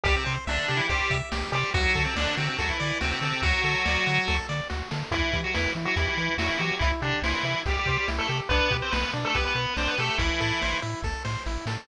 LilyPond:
<<
  \new Staff \with { instrumentName = "Lead 1 (square)" } { \time 4/4 \key e \minor \tempo 4 = 142 <g g'>16 <c c'>8 r16 <d d'>8. <e e'>16 <g g'>8. r8. <g g'>8 | <fis fis'>8. <c c'>16 <d d'>8 <c c'>16 <c c'>16 <fis fis'>16 <e e'>8. <c c'>16 <c c'>16 <c c'>8 | <fis fis'>2~ <fis fis'>8 r4. | <e e'>8. <fis fis'>16 <e e'>8 r16 <fis fis'>16 <e e'>16 <e e'>8. <fis fis'>16 <e e'>16 <fis fis'>8 |
<e e'>16 r16 <d d'>8 <e e'>4 <g g'>16 <g g'>8 <g g'>16 r16 <a a'>16 <a a'>16 r16 | <b b'>8. <c' c''>16 <b b'>8 r16 <a a'>16 <b b'>16 <b b'>8. <c' c''>16 <b b'>16 <a a'>8 | <e e'>4. r2 r8 | }
  \new Staff \with { instrumentName = "Lead 1 (square)" } { \time 4/4 \key e \minor g'8 c''8 e''8 g'8 c''8 e''8 g'8 c''8 | fis'8 a'8 d''8 fis'8 a'8 d''8 fis'8 a'8 | fis'8 a'8 d''8 fis'8 a'8 d''8 fis'8 a'8 | e'8 g'8 b'8 e'8 g'8 b'8 e'8 g'8 |
e'8 g'8 c''8 e'8 g'8 c''8 e'8 g'8 | d'8 g'8 b'8 d'8 g'8 b'8 d'8 g'8 | e'8 a'8 c''8 e'8 a'8 c''8 e'8 a'8 | }
  \new Staff \with { instrumentName = "Synth Bass 1" } { \clef bass \time 4/4 \key e \minor c,8 c8 c,8 c8 c,8 c8 c,8 c8 | d,8 d8 d,8 d8 d,8 d8 d,8 d8 | d,8 d8 d,8 d8 d,8 d8 d,8 d8 | e,8 e8 e,8 e8 e,8 e8 e,8 e8 |
c,8 c8 c,8 c8 c,8 c8 c,8 c8 | b,,8 b,8 b,,8 b,8 b,,8 b,8 b,,8 b,8 | a,,8 a,8 a,,8 a,8 a,,8 a,8 a,,8 a,8 | }
  \new DrumStaff \with { instrumentName = "Drums" } \drummode { \time 4/4 <hh bd>8 hh8 sn8 hh8 <hh bd>8 <hh bd>8 sn8 hh8 | <hh bd>8 <hh bd>8 sn8 hh8 <hh bd>8 hh8 sn8 hh8 | <hh bd>8 hh8 sn8 hh8 <bd sn>8 sn8 sn8 sn8 | <hh bd>8 <hh bd>8 sn8 hh8 <hh bd>8 hh8 sn8 hh8 |
<hh bd>8 hh8 sn8 hh8 <hh bd>8 <hh bd>8 sn8 hh8 | <hh bd>8 <hh bd>8 sn8 hh8 <hh bd>8 hh8 sn8 hh8 | <hh bd>8 hh8 sn8 hh8 <bd sn>8 sn8 sn8 sn8 | }
>>